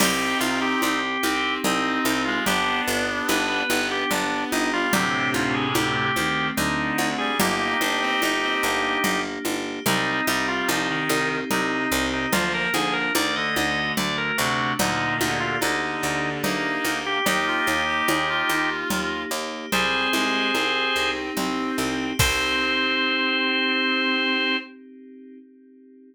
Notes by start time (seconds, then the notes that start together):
0.00 C2 C4 D#4 G4, crash, cowbell, low conga
0.40 C2 F4 G4, high conga
0.62 G4
0.82 C2 C4 G4, cowbell, high conga
1.23 C2 C4 D#4, high conga
1.64 C2 C4 D#4, cowbell, low conga
2.05 C2 G4, high conga
2.25 G#3 F4
2.46 G1 B3 D4 G4, cowbell, low conga
2.88 G1 G4
3.28 G1 B3 B4, cowbell, high conga
3.70 G1 B3 D4, high conga
3.91 G4
4.11 G1 B3 D4, cowbell, low conga
4.52 G1 D#4 G4, high conga
4.73 G3 F4
4.93 D2 A2 C3 A3 C4 D4 G4, cowbell, low conga
5.34 D2 F4, high conga
5.54 G#4
5.74 D2 A3 G4, cowbell, high conga
6.16 D2 D#3 C4, high conga
6.57 D2 D3 D4 D#4, cowbell, low conga
6.98 D2 F#4, high conga
7.18 G3 G#4
7.40 G1 A#3 D#4 G4, cowbell, low conga
7.81 G1 D4 G4, high conga
8.01 C4
8.22 G1 A#3 D#4, cowbell, high conga
8.42 C4
8.63 G1 A#3 D4
9.04 G1 A#3, cowbell, low conga
9.45 G1 G4, high conga
9.86 C2 G3 C4 D#4, cowbell, low conga
10.27 C2 G3 D#4 G4, high conga
10.48 F4
10.68 C2 F3 C4 D#4, high conga
10.89 D#3
11.09 C2 D#4, cowbell, high conga
11.51 C2 C3 C4 D#4, cowbell, low conga
11.92 C2 C3 G4
12.13 D#4
12.33 D2 F3 A#3 F4, cowbell, low conga
12.54 A#4
12.73 D2 F3 D4 G#4, high conga
12.93 A#4
13.15 D2 D#3 A3 D5, cowbell, high conga
13.36 D3 D#5
13.56 D2 F#4 D#5, high conga
13.97 D2 D3 A3 D5, cowbell, low conga
14.18 A#4
14.38 D2 C3 D4 F#4
14.79 D2 A#2 D3 A#3 D#4, cowbell, low conga
15.20 D2 D#4 G4, high conga
15.40 F4
15.61 D2 D3 A#3 D#4, cowbell, high conga
16.02 D2 D4
16.43 D2 A#3 D#4, cowbell, low conga
16.85 D2 G4, high conga
17.06 G4
17.26 D#2 A#3 D#4 G4, cowbell, low conga
17.47 F4
17.67 D#2 G4, high conga
17.88 G4
18.08 D#2 A#3 G#4, cowbell, high conga
18.29 F4
18.49 D#2 D#4, high conga
18.90 D#2 A#3, cowbell, low conga
19.31 D#2 G4
19.72 C2 G3 C4 G#4 C5, cowbell, low conga
20.13 C2 G#3 G4, high conga
20.54 C2 C4, cowbell, high conga
20.96 C2 D#4
21.36 C2 C4, cowbell, low conga
21.78 C2 G4
22.19 C2 C4 D#4 G4 C5, kick, crash